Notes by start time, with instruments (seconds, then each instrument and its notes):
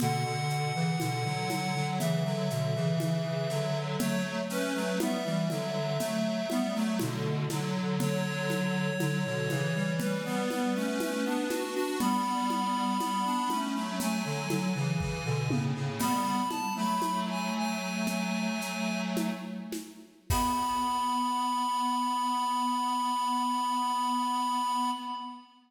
0.00 lead 1 (square) B2 D3 F#5, low conga, shaker
0.25 lead 1 (square) B2 D3
0.50 shaker
0.75 lead 1 (square) C#3 E3
1.00 lead 1 (square) B2 D3, high conga, shaker
1.25 lead 1 (square) D3 F#3
1.50 lead 1 (square) D3 F#3, high conga, shaker
1.75 lead 1 (square) D3 F#3
1.99 lead 1 (square) C#3 E3 E5, low conga, shaker
2.25 lead 1 (square) D3 F#3
2.50 lead 1 (square) B2 D3, shaker
2.75 lead 1 (square) C#3 E3
3.00 lead 1 (square) C#3 E3, high conga, shaker
3.50 lead 1 (square) D3 F#3, snare, shaker
3.99 lead 1 (square) F#3 A3 C#5, low conga, shaker
4.50 lead 1 (square) A3 C#4 B4, shaker
4.75 lead 1 (square) F#3 A3
5.00 lead 1 (square) G3 B3 E5, high conga, shaker
5.25 lead 1 (square) E3 G3
5.50 lead 1 (square) D3 F#3, high conga, shaker
6.00 lead 1 (square) F#3 A3, low conga, shaker
6.50 lead 1 (square) G3 B3, high conga, shaker
6.75 lead 1 (square) F#3 A3
6.99 lead 1 (square) B2 D3, high conga, shaker
7.50 lead 1 (square) D3 F#3, snare, high conga, shaker
8.00 lead 1 (square) D3 F#3 C#5, low conga, shaker
8.50 high conga, shaker
9.00 lead 1 (square) D3 F#3, high conga, shaker
9.25 lead 1 (square) B2 D3
9.50 lead 1 (square) C#3 E3, high conga, shaker
9.75 lead 1 (square) E3 G3
9.99 lead 1 (square) E3 G3 B4, low conga, shaker
10.25 lead 1 (square) G3 B3
10.50 lead 1 (square) G3 B3, high conga, shaker
10.75 lead 1 (square) A3 C#4
11.00 lead 1 (square) A3 C#4, high conga, shaker
11.25 lead 1 (square) B3 D4
11.50 lead 1 (square) D4 F#4, snare, high conga, shaker
11.75 lead 1 (square) D4 F#4
11.99 lead 1 (square) G3 B3 B5, low conga, shaker
12.50 high conga, shaker
13.00 lead 1 (square) G3 B3, high conga, shaker
13.25 lead 1 (square) B3 D4
13.50 lead 1 (square) A3 C#4, high conga, shaker
13.75 lead 1 (square) F#3 A3
14.00 lead 1 (square) F#3 A3 G#5, low conga, shaker
14.25 lead 1 (square) D3 F#3
14.50 lead 1 (square) D3 F#3, high conga, shaker
14.75 lead 1 (square) C#3 E3
15.00 lead 1 (square) C#3 E3, kick
15.25 lead 1 (square) B2 D3
15.50 lead 1 (square) A2 C#3, high tom
15.75 lead 1 (square) A2 C#3
16.00 lead 1 (square) G3 B3 B5, crash, low conga, shaker
16.49 lead 1 (square) A5, high conga, shaker
16.76 lead 1 (square) F#3 A3 B5
17.02 high conga, shaker
17.29 lead 1 (square) G#5
17.56 lead 1 (square) G#5
18.07 low conga, shaker
18.61 shaker
19.17 high conga, shaker
19.72 snare, high conga, shaker
20.30 lead 1 (square) B3 B5, kick, crash